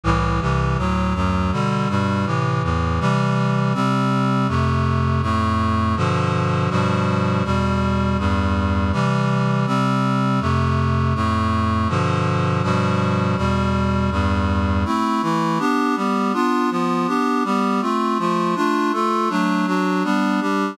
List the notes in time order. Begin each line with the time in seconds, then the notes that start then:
0.04 C2 A2 E3
0.41 C2 C3 E3
0.77 D2 A2 F#3
1.14 D2 F#2 F#3
1.52 B2 D3 G3
1.89 G2 B2 G3
2.26 A2 C3 E3
2.63 E2 A2 E3
3.00 C3 E3 G3
3.74 C3 G3 C4
4.48 F2 C3 A3
5.22 F2 A2 A3
5.96 G2 B2 D3 F3
6.70 G2 B2 F3 G3
7.44 E2 B2 G3
8.18 E2 G2 G3
8.92 C3 E3 G3
9.66 C3 G3 C4
10.40 F2 C3 A3
11.15 F2 A2 A3
11.89 G2 B2 D3 F3
12.63 G2 B2 F3 G3
13.37 E2 B2 G3
14.11 E2 G2 G3
14.85 A3 C4 E4
15.22 E3 A3 E4
15.59 B3 D4 G4
15.96 G3 B3 G4
16.33 B3 D4 F4
16.70 F3 B3 F4
17.07 B3 D4 G4
17.44 G3 B3 G4
17.81 A3 C4 F4
18.18 F3 A3 F4
18.55 A3 D4 F4
18.92 A3 F4 A4
19.29 F#3 A3 D4
19.66 F#3 D4 F#4
20.04 G3 B3 D4
20.41 G3 D4 G4